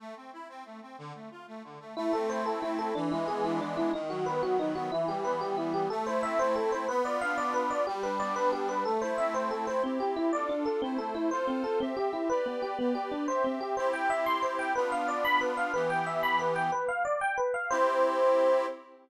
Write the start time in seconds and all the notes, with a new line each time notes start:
0.00 A3
0.16 C4
0.33 E4
0.49 C4
0.66 A3
0.82 C4
0.98 D3
1.15 A3
1.31 F4
1.48 A3
1.64 D3
1.80 A3
1.97 A3 E4
2.13 C4 A4
2.29 E4 C5
2.46 A3 A4
2.62 C4 E4
2.78 E4 A4
2.95 E3 D4
3.11 G#3 E4
3.28 B3 G#4
3.44 D4 E4
3.60 E3 D4
3.77 G#3 E4
3.93 D#3 D#4
4.10 F#3 F#4
4.26 B3 B4
4.43 D#3 F#4
4.59 F#3 D#4
4.75 B3 F#4
4.92 E3 E4
5.08 G3 G4
5.25 B3 B4
5.41 E3 G4
5.57 G3 E4
5.73 B3 G4
5.90 A3 A4
6.06 E4 C5
6.23 C4 E5
6.39 E4 C5
6.56 A3 A4
6.72 E4 C5
6.88 B3 B4
7.05 F4 D5
7.21 D4 F5
7.38 F4 D5
7.54 B3 B4
7.70 F4 D5
7.87 G3 G4
8.03 D4 B4
8.20 B3 D5
8.36 D4 B4
8.52 G3 G4
8.69 D4 B4
8.85 A3 A4
9.02 E4 C5
9.18 C4 E5
9.34 E4 C5
9.51 A3 A4
9.67 E4 C5
9.83 C4 E4 G4
10.00 G4
10.16 E4
10.33 D4 F4 A4 D5
10.49 D4
10.66 A4
10.82 A3 C4 E4 C5
10.98 A4
11.15 E4
11.31 F4 A4 C5
11.47 C4
11.64 A4
11.80 C4 G4 E5
11.97 G4
12.13 E4
12.30 G4 B4 D5
12.46 B3
12.62 G4
12.78 B3 G4 B4 D5
12.95 G4
13.12 D4
13.28 C4 G4 C5 E5
13.44 C4
13.61 G4
13.77 C4 E4 G4 C5
13.93 G5
14.10 E5
14.26 C6
14.42 C5
14.59 G5
14.75 B3 D4 F4 B4
14.92 F5
15.08 D5
15.25 B5
15.41 B4
15.57 F5
15.74 E3 B3 G4 B4
15.90 G5
16.06 E5
16.23 B5
16.39 B4
16.56 G5
16.72 B4
16.88 F5
17.05 D5
17.21 G5
17.38 B4
17.54 F5
17.70 C4 E4 G4 C5